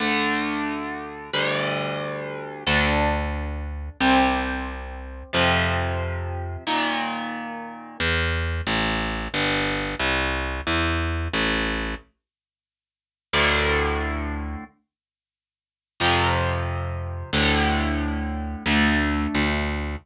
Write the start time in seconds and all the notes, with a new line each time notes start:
0.00 D2 D3 A3
1.33 D2 D3 G3
2.66 D2 D4 A4
4.00 C2 C4 G4
5.33 F2 C3 F3
6.67 A#2 D#3
8.00 E2
8.67 A1
9.34 G1
10.00 C2
10.67 E2
11.33 A1
13.33 D2 A2 D3
16.00 F2 C3 F3
17.33 D2 A2 D3
18.66 D2 A3 D4
19.35 D2